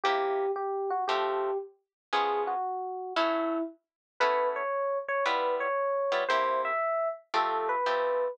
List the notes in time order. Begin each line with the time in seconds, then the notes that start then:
0.04 C3 A#3 E4 G4
0.56 G4
0.90 F#4
1.08 F3 A3 C4 G4
2.13 F3 G#3 B3 C#4 G#4
2.47 F#4
3.16 F#3 A3 C#4 E4
4.20 A3 B3 C#4 E4 B4
4.56 C#5
5.08 C#5
5.26 G3 B3 E4 F4 B4
5.60 C#5
6.12 G3 B3 E4 F4
6.29 C3 A#3 E4 G4 C5
6.65 E5
7.34 F3 A3 C4 G4 A4
7.69 B4
7.86 F3 A3 C4 G4